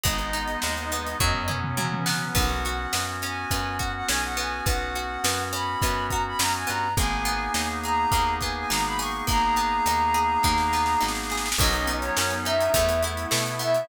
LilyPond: <<
  \new Staff \with { instrumentName = "Flute" } { \time 4/4 \key b \major \tempo 4 = 104 dis''2~ dis''8 r4. | fis''4. gis''4 fis''16 fis''16 gis''16 fis''16 gis''8 | fis''4. b''4 ais''16 b''16 ais''16 gis''16 ais''8 | gis''4. ais''4 gis''16 gis''16 ais''16 b''16 cis'''8 |
ais''2.~ ais''8 r8 | dis''8. cis''8. e''4 r4 e''8 | }
  \new Staff \with { instrumentName = "Drawbar Organ" } { \time 4/4 \key b \major <gis b dis'>2 <fis b cis'>2 | <b cis' fis'>1~ | <b cis' fis'>1 | <ais b dis' gis'>1~ |
<ais b dis' gis'>1 | <fis b cis' dis'>2 <a b e'>2 | }
  \new Staff \with { instrumentName = "Pizzicato Strings" } { \time 4/4 \key b \major gis8 dis'8 gis8 b8 fis8 cis'8 fis8 b8 | b8 fis'8 b8 cis'8 b8 fis'8 cis'8 b8 | b8 fis'8 b8 cis'8 b8 fis'8 cis'8 b8 | ais8 b8 dis'8 gis'8 ais8 b8 dis'8 gis'8 |
ais8 b8 dis'8 gis'8 ais8 b8 dis'8 gis'8 | fis8 b8 cis'8 dis'8 a8 e'8 a8 b8 | }
  \new Staff \with { instrumentName = "Electric Bass (finger)" } { \clef bass \time 4/4 \key b \major gis,,4 dis,4 fis,4 cis4 | b,,4 fis,4 fis,4 b,,4 | b,,4 fis,4 fis,4 fis,8 g,8 | gis,,4 dis,4 dis,4 gis,,4 |
gis,,4 dis,4 dis,4 gis,,4 | b,,4 fis,4 e,4 b,4 | }
  \new Staff \with { instrumentName = "Pad 5 (bowed)" } { \time 4/4 \key b \major <gis b dis'>2 <fis b cis'>2 | r1 | r1 | r1 |
r1 | <fis b cis' dis'>2 <a b e'>2 | }
  \new DrumStaff \with { instrumentName = "Drums" } \drummode { \time 4/4 <hh bd>16 hh16 hh16 hh16 sn16 hh16 hh16 hh16 <bd tomfh>16 tomfh16 toml16 toml16 tommh16 tommh16 sn8 | <cymc bd>8 hh8 sn8 hh8 <hh bd>8 <hh bd>8 sn8 hh8 | <hh bd>8 hh8 sn8 hh8 <hh bd>8 <hh bd>8 sn8 hh8 | <hh bd>8 hh8 sn8 hh8 <hh bd>8 <hh bd>8 sn8 hho8 |
<hh bd>8 hh8 hh8 hh8 <bd sn>16 sn16 sn16 sn16 sn32 sn32 sn32 sn32 sn32 sn32 sn32 sn32 | <cymc bd>16 hh16 hh16 hh16 sn16 hh16 hh16 hh16 <hh bd>16 hh16 hh16 hh16 sn16 hh16 hh16 hh16 | }
>>